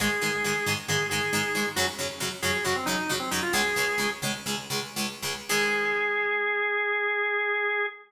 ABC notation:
X:1
M:4/4
L:1/16
Q:1/4=136
K:Abmix
V:1 name="Drawbar Organ"
A8 A2 A6 | G z5 A2 G C E3 C E F | "^rit." A6 z10 | A16 |]
V:2 name="Acoustic Guitar (steel)" clef=bass
[A,,E,A,]2 [A,,E,A,]2 [A,,E,A,]2 [A,,E,A,]2 [A,,E,A,]2 [A,,E,A,]2 [A,,E,A,]2 [A,,E,A,]2 | [G,,D,G,]2 [G,,D,G,]2 [G,,D,G,]2 [G,,D,G,]2 [G,,D,G,]2 [G,,D,G,]2 [G,,D,G,]2 [G,,D,G,]2 | "^rit." [D,,D,A,]2 [D,,D,A,]2 [D,,D,A,]2 [D,,D,A,]2 [D,,D,A,]2 [D,,D,A,]2 [D,,D,A,]2 [D,,D,A,]2 | [A,,E,A,]16 |]